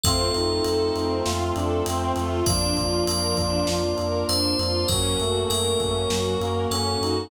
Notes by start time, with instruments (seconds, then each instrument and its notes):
0.04 synth bass 2 F2, brass section A3 C4 F4, string ensemble 1 C4, clarinet F4, tubular bells A4, kick, ride
0.34 synth bass 2 F2, clarinet D#4, string ensemble 1 F4, ride
0.64 synth bass 2 F2, string ensemble 1 A4, ride
0.95 synth bass 2 F2, string ensemble 1 C4, ride
1.25 synth bass 2 F2, clarinet F4, string ensemble 1 F4, snare
1.56 synth bass 2 F2, clarinet D4, string ensemble 1 A4, ride
1.86 synth bass 2 F2, clarinet C4, string ensemble 1 C4, ride
2.16 synth bass 2 F2, clarinet A3, string ensemble 1 F4, ride
2.46 synth bass 2 F2, clarinet F3, brass section A#3 D4 F4, string ensemble 1 D4, tubular bells D5, kick, ride
2.77 synth bass 2 F2, string ensemble 1 F4, kick, ride
3.07 synth bass 2 F2, string ensemble 1 A#4, tubular bells D5, ride
3.37 synth bass 2 F2, string ensemble 1 D4, kick, ride
3.67 synth bass 2 F2, string ensemble 1 F4, snare
3.98 synth bass 2 F2, string ensemble 1 A#4, ride
4.28 synth bass 2 F2, string ensemble 1 D4, tubular bells C5, ride
4.59 synth bass 2 F2, string ensemble 1 F4, ride
4.88 synth bass 2 F#2, clarinet F#3, brass section A#3 C#4 F#4, string ensemble 1 C#4, tubular bells A#4, kick, ride
5.19 synth bass 2 F#2, clarinet A3, string ensemble 1 F#4, ride
5.50 synth bass 2 F#2, tubular bells A#4, string ensemble 1 A#4, ride
5.80 synth bass 2 F#2, string ensemble 1 C#4, kick, ride
6.10 synth bass 2 F#2, clarinet F#3, string ensemble 1 F#4, snare
6.40 synth bass 2 F#2, clarinet A#3, string ensemble 1 A#4, ride
6.71 synth bass 2 F#2, clarinet C#4, string ensemble 1 C#4, tubular bells A4, ride
7.01 synth bass 2 F#2, clarinet D#4, string ensemble 1 F#4, ride